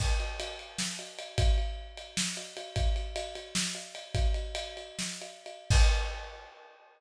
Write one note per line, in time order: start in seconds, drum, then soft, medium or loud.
0.00 kick medium
0.00 crash medium
0.20 ride medium
0.40 ride medium
0.59 ride medium
0.79 snare medium
0.99 ride medium
1.19 ride medium
1.38 kick medium
1.38 ride loud
1.58 ride medium
1.97 ride medium
2.17 snare medium
2.37 ride medium
2.57 ride medium
2.76 kick medium
2.76 ride medium
2.96 ride medium
3.16 ride medium
3.35 ride medium
3.55 snare loud
3.75 ride medium
3.95 ride medium
4.15 kick medium
4.15 ride medium
4.34 ride medium
4.55 ride medium
4.77 ride medium
4.99 snare medium
5.22 ride medium
5.46 ride medium
5.70 kick loud
5.70 crash loud